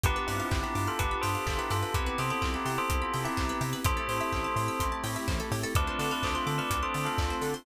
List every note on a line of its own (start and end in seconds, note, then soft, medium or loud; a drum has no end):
0.03 0.18 G1 medium
0.03 0.90 B3 loud
0.03 1.93 B3 medium
0.03 0.90 D4 medium
0.03 1.93 D4 medium
0.03 0.90 F4 medium
0.03 1.93 F4 medium
0.03 0.90 G4 medium
0.03 0.15 G4 medium
0.03 1.93 G4 loud
0.03 0.28 G4 medium
0.03 0.28 B4 loud
0.03 kick loud
0.03 closed hi-hat loud
0.16 0.27 B4 medium
0.27 0.41 G2 medium
0.27 0.57 C4 medium
0.27 0.57 E4 medium
0.27 0.39 D5 medium
0.27 open hi-hat medium
0.40 0.50 F5 medium
0.51 0.64 G1 medium
0.51 0.62 G5 medium
0.51 kick loud
0.51 clap loud
0.63 0.86 E4 medium
0.63 0.86 G4 medium
0.63 0.74 B5 medium
0.75 0.88 G2 medium
0.75 0.86 D6 medium
0.75 open hi-hat medium
0.87 0.99 F4 medium
0.87 0.99 A4 medium
0.87 0.98 F6 medium
0.99 1.14 G1 medium
0.99 1.85 B3 medium
0.99 1.85 D4 medium
0.99 1.85 F4 medium
0.99 1.20 G4 medium
0.99 1.85 G4 medium
0.99 1.20 B4 medium
0.99 1.10 D6 medium
0.99 kick loud
0.99 closed hi-hat loud
1.11 1.22 B5 medium
1.21 1.37 G2 medium
1.21 1.43 A4 medium
1.21 1.43 C5 medium
1.21 1.34 G5 medium
1.21 open hi-hat loud
1.35 1.46 F5 medium
1.46 1.59 G1 medium
1.46 1.58 F4 medium
1.46 1.58 A4 medium
1.46 1.57 D5 medium
1.46 kick loud
1.46 clap loud
1.58 1.69 E4 medium
1.58 1.69 G4 medium
1.58 1.69 B4 medium
1.70 1.84 G2 medium
1.70 1.94 F4 medium
1.70 1.81 G4 medium
1.70 1.94 A4 medium
1.70 open hi-hat medium
1.82 1.93 B4 medium
1.94 2.09 C2 medium
1.94 3.83 B3 medium
1.94 2.80 B3 medium
1.94 3.83 C4 medium
1.94 2.80 C4 medium
1.94 3.83 E4 medium
1.94 2.80 E4 medium
1.94 3.83 G4 medium
1.94 2.05 G4 medium
1.94 2.15 G4 medium
1.94 2.80 G4 medium
1.94 2.15 B4 medium
1.94 kick loud
1.94 closed hi-hat loud
2.06 2.17 B4 medium
2.18 2.31 C3 medium
2.18 2.30 A4 medium
2.18 2.29 C5 medium
2.18 2.30 C5 medium
2.18 open hi-hat medium
2.30 2.41 A4 medium
2.30 2.43 C5 loud
2.30 2.41 E5 medium
2.41 2.56 C2 medium
2.41 2.52 F4 medium
2.41 2.52 A4 medium
2.41 2.53 G5 medium
2.41 kick medium
2.41 clap loud
2.54 2.65 E4 medium
2.54 2.65 G4 medium
2.54 2.64 B5 medium
2.65 2.78 C3 medium
2.65 2.77 E4 medium
2.65 2.77 G4 medium
2.65 2.77 C6 medium
2.65 open hi-hat medium
2.78 3.01 A4 medium
2.78 3.01 C5 medium
2.78 2.89 E6 medium
2.89 3.03 C2 medium
2.89 3.75 B3 medium
2.89 3.75 C4 medium
2.89 3.75 E4 medium
2.89 3.75 G4 medium
2.89 3.00 C6 medium
2.89 kick loud
2.89 closed hi-hat loud
3.02 3.22 F4 medium
3.02 3.22 A4 medium
3.02 3.12 B5 medium
3.14 3.27 C3 medium
3.14 3.24 G5 medium
3.14 open hi-hat medium
3.24 3.58 E4 medium
3.24 3.58 G4 medium
3.24 3.36 E5 medium
3.37 3.52 C2 medium
3.37 3.48 C5 medium
3.37 kick loud
3.37 clap loud
3.49 3.60 B4 medium
3.61 3.74 C3 medium
3.61 3.72 G4 medium
3.61 open hi-hat medium
3.73 3.84 B4 medium
3.85 3.99 A1 medium
3.85 4.71 A3 medium
3.85 5.74 A3 medium
3.85 4.71 C4 medium
3.85 5.74 C4 medium
3.85 4.71 E4 medium
3.85 5.74 E4 medium
3.85 4.71 G4 loud
3.85 3.96 G4 medium
3.85 5.74 G4 medium
3.85 4.84 A4 medium
3.85 4.84 C5 loud
3.85 kick loud
3.85 closed hi-hat loud
3.97 4.08 A4 medium
4.08 4.21 A2 medium
4.08 4.19 C5 medium
4.08 open hi-hat medium
4.21 4.31 E5 medium
4.32 4.47 A1 medium
4.32 4.43 G5 medium
4.32 kick loud
4.32 clap loud
4.44 4.55 A5 medium
4.56 4.69 A2 medium
4.56 4.67 C6 medium
4.56 open hi-hat medium
4.68 4.79 E6 medium
4.80 4.93 A1 medium
4.80 5.65 A3 medium
4.80 5.65 C4 medium
4.80 5.65 E4 medium
4.80 5.65 G4 medium
4.80 4.91 C6 medium
4.80 kick loud
4.80 closed hi-hat loud
4.92 5.03 A5 medium
5.04 5.17 A2 medium
5.04 5.15 G5 medium
5.04 open hi-hat loud
5.16 5.27 E5 medium
5.28 5.41 A1 medium
5.28 5.38 C5 medium
5.28 kick loud
5.28 clap loud
5.40 5.50 A4 medium
5.51 5.65 A2 medium
5.51 5.62 G4 medium
5.51 open hi-hat medium
5.63 5.74 A4 medium
5.75 5.89 D2 medium
5.75 6.61 A3 loud
5.75 7.64 A3 medium
5.75 6.61 C4 medium
5.75 7.64 C4 medium
5.75 6.61 D4 medium
5.75 7.64 D4 medium
5.75 6.61 F4 medium
5.75 7.64 F4 medium
5.75 5.86 A4 medium
5.75 5.97 B4 medium
5.75 5.97 D5 medium
5.75 kick loud
5.75 closed hi-hat loud
5.87 5.98 C5 medium
5.99 6.12 D3 medium
5.99 6.12 B4 medium
5.99 6.10 D5 medium
5.99 6.12 D5 medium
5.99 open hi-hat loud
6.11 6.24 B4 medium
6.11 6.24 D5 medium
6.11 6.22 F5 medium
6.23 6.37 D2 medium
6.23 6.35 A4 medium
6.23 6.35 C5 medium
6.23 6.34 A5 medium
6.23 kick loud
6.23 clap loud
6.35 6.47 F4 medium
6.35 6.47 A4 medium
6.35 6.46 C6 medium
6.47 6.60 D3 medium
6.47 6.58 F4 medium
6.47 6.58 A4 medium
6.47 6.57 D6 medium
6.47 open hi-hat medium
6.58 6.78 B4 medium
6.58 6.78 D5 medium
6.58 6.70 F6 medium
6.70 6.83 D2 medium
6.70 7.57 A3 medium
6.70 7.57 C4 medium
6.70 7.57 D4 medium
6.70 7.57 F4 medium
6.70 6.81 D6 medium
6.70 kick loud
6.70 closed hi-hat loud
6.83 7.05 A4 medium
6.83 7.05 C5 medium
6.83 6.93 C6 medium
6.94 7.08 D3 medium
6.94 7.05 A5 medium
6.94 open hi-hat medium
7.05 7.35 F4 medium
7.05 7.35 A4 medium
7.05 7.17 F5 medium
7.18 7.32 D2 medium
7.18 7.29 D5 medium
7.18 kick loud
7.18 clap loud
7.30 7.41 C5 medium
7.41 7.54 D3 medium
7.41 7.53 A4 medium
7.41 open hi-hat medium
7.54 7.65 C5 medium